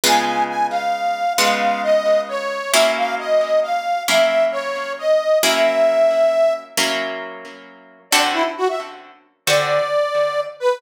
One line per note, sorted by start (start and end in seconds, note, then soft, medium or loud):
0.04 1.25 C#3 loud
0.04 1.25 G#3 loud
0.04 1.25 B3 loud
0.04 1.25 F4 medium
0.04 0.25 G#5 loud
0.25 0.44 G#5 medium
0.49 0.67 G#5 medium
0.71 1.33 F5 medium
1.38 2.59 C#3 medium
1.38 2.59 G#3 medium
1.38 2.59 B3 medium
1.38 2.59 F4 medium
1.38 1.82 F5 medium
1.83 2.21 D#5 medium
2.28 2.72 C#5 medium
2.72 3.95 F#3 loud
2.72 3.95 A#3 loud
2.72 3.95 C#4 medium
2.72 3.95 E4 loud
2.72 2.91 E5 medium
2.96 3.15 F5 medium
3.19 3.60 D#5 medium
3.62 4.03 F5 medium
4.08 5.29 F#3 medium
4.08 5.29 A#3 medium
4.08 5.29 C#4 medium
4.08 5.29 E4 medium
4.08 4.45 E5 medium
4.51 4.93 C#5 medium
4.98 5.39 D#5 medium
5.43 6.64 F#3 medium
5.43 6.64 A#3 loud
5.43 6.64 C#4 loud
5.43 6.64 E4 loud
5.43 6.53 E5 loud
6.77 7.99 F#3 medium
6.77 7.99 A#3 loud
6.77 7.99 C#4 medium
6.77 7.99 E4 medium
8.11 8.44 D3 loud
8.11 8.44 C4 loud
8.11 8.44 F#4 loud
8.11 8.44 A4 loud
8.11 8.21 D5 medium
8.33 8.44 E4 medium
8.57 8.68 F#4 medium
8.68 8.79 E5 medium
9.46 9.79 D3 medium
9.46 9.79 C4 loud
9.46 9.79 F#4 medium
9.46 9.79 A4 medium
9.46 10.40 D5 medium
10.60 10.78 B4 loud